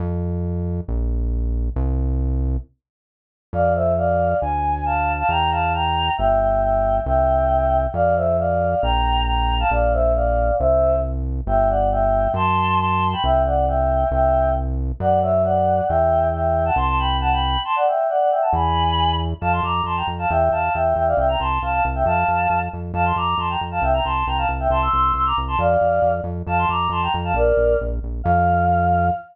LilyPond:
<<
  \new Staff \with { instrumentName = "Choir Aahs" } { \time 2/4 \key f \major \tempo 4 = 136 r2 | r2 | r2 | r2 |
<d'' f''>8 <c'' e''>8 <d'' f''>4 | gis''4 <f'' a''>8. <f'' a''>16 | <g'' bes''>8 <f'' a''>8 <g'' bes''>4 | <e'' g''>8 <e'' g''>8 <e'' g''>4 |
<e'' g''>2 | <d'' f''>8 <c'' e''>8 <d'' f''>4 | <g'' bes''>4 <g'' bes''>8. <f'' a''>16 | <d'' f''>8 <c'' e''>8 <d'' f''>4 |
<c'' e''>4 r4 | \key g \major <e'' g''>8 <d'' fis''>8 <e'' g''>4 | <a'' c'''>4 <a'' c'''>8. <g'' b''>16 | <e'' g''>8 <d'' fis''>8 <e'' g''>4 |
<e'' g''>4 r4 | <d'' fis''>8 <cis'' e''>8 <d'' fis''>4 | <e'' g''>4 <e'' g''>8. <fis'' a''>16 | <a'' c'''>16 <a'' c'''>16 <g'' b''>8 <fis'' a''>16 <g'' b''>8. |
<a'' c'''>16 <d'' fis''>16 <e'' g''>8 <d'' fis''>16 <d'' fis''>16 <e'' g''>16 <fis'' a''>16 | <gis'' b''>4. r8 | \key f \major <f'' a''>16 <a'' c'''>16 <bes'' d'''>8 <a'' c'''>16 <g'' bes''>16 r16 <f'' a''>16 | <e'' g''>8 <f'' a''>8 <e'' g''>8 <e'' g''>16 <d'' f''>16 |
<e'' g''>16 <g'' bes''>16 <a'' c'''>8 <f'' a''>16 <f'' a''>16 r16 <e'' g''>16 | <f'' a''>4. r8 | <f'' a''>16 <a'' c'''>16 <bes'' d'''>8 <a'' c'''>16 <g'' bes''>16 r16 <f'' a''>16 | <e'' g''>16 <g'' bes''>16 <a'' c'''>8 <g'' bes''>16 <f'' a''>16 r16 <e'' g''>16 |
<a'' c'''>16 <c''' e'''>16 <c''' e'''>8 <c''' e'''>16 <bes'' d'''>16 r16 <a'' c'''>16 | <d'' f''>4. r8 | <f'' a''>16 <a'' c'''>16 <bes'' d'''>8 <a'' c'''>16 <g'' bes''>16 r16 <f'' a''>16 | <bes' d''>4 r4 |
f''2 | }
  \new Staff \with { instrumentName = "Synth Bass 1" } { \clef bass \time 2/4 \key f \major f,2 | bes,,2 | c,2 | r2 |
f,2 | d,2 | e,2 | g,,2 |
c,2 | f,2 | bes,,2 | bes,,2 |
c,2 | \key g \major g,,2 | fis,2 | c,2 |
c,2 | fis,2 | e,2 | c,2 |
r2 | e,2 | \key f \major f,8 f,8 f,8 f,8 | e,8 e,8 e,8 e,8 |
c,8 c,8 c,8 c,8 | f,8 f,8 f,8 f,8 | f,8 f,8 f,8 f,8 | c,8 c,8 c,8 c,8 |
c,8 c,8 c,8 c,8 | f,8 f,8 f,8 f,8 | f,8 f,8 f,8 f,8 | bes,,8 bes,,8 bes,,8 bes,,8 |
f,2 | }
>>